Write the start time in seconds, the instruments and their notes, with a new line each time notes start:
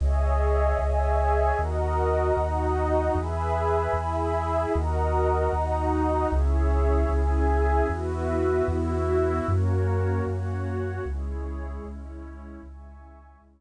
0.00 synth bass 2 C#2, pad 2 (warm) G#4 C#5 D#5 E5 G#5
0.79 synth bass 2 C#2, pad 2 (warm) G#4 C#5 E5 G#5
1.58 synth bass 2 D#2, pad 2 (warm) F#4 A#4 D#5 F#5 A#5
2.36 synth bass 2 D#2, pad 2 (warm) D#4 F#4 D#5
3.15 synth bass 2 E2, pad 2 (warm) G#4 B4 E5 G#5 B5
3.93 synth bass 2 E2, pad 2 (warm) E4 G#4 E5
4.73 synth bass 2 D#2, pad 2 (warm) F#4 A#4 D#5 F#5 A#5
5.53 synth bass 2 D#2, pad 2 (warm) D#4 F#4 D#5
6.32 synth bass 2 C#2, pad 2 (warm) C#4 E4 G#4 C#5 E5
7.09 synth bass 2 C#2, pad 2 (warm) G#4 E5 G#5
7.89 synth bass 2 E2, pad 2 (warm) B3 E4 F#4 B4 E5
8.68 synth bass 2 E2, pad 2 (warm) E4 F#4 E5
9.47 synth bass 2 F#2, pad 2 (warm) A#3 C#4 F#4 A#4 C#5
10.27 synth bass 2 F#2, pad 2 (warm) F#4 C#5 F#5
11.05 synth bass 2 C#2, pad 2 (warm) G#3 C#4 E4 G#4 C#5
11.84 synth bass 2 C#2, pad 2 (warm) C#4 E4 C#5
12.63 synth bass 2 C#2, pad 2 (warm) G#3 C#4 E4 E5 G#5 C#6
13.41 synth bass 2 C#2, pad 2 (warm) C#5 E5 C#6